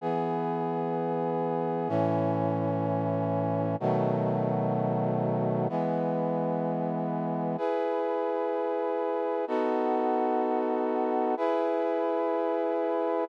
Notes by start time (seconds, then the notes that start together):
0.01 E3 B3 G#4
1.88 A2 E3 C#4
3.80 B2 D#3 F#3 A3
5.69 E3 G#3 B3
7.58 E4 G#4 B4
9.47 B3 D#4 F#4 A4
11.37 E4 G#4 B4